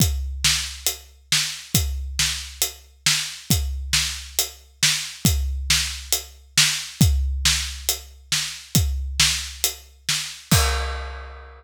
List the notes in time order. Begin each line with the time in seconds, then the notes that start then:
0.00 kick, closed hi-hat
0.44 snare
0.86 closed hi-hat
1.32 snare
1.75 kick, closed hi-hat
2.19 snare
2.62 closed hi-hat
3.06 snare
3.50 kick, closed hi-hat
3.93 snare
4.39 closed hi-hat
4.83 snare
5.25 kick, closed hi-hat
5.70 snare
6.12 closed hi-hat
6.58 snare
7.01 kick, closed hi-hat
7.45 snare
7.89 closed hi-hat
8.32 snare
8.75 kick, closed hi-hat
9.20 snare
9.64 closed hi-hat
10.09 snare
10.51 kick, crash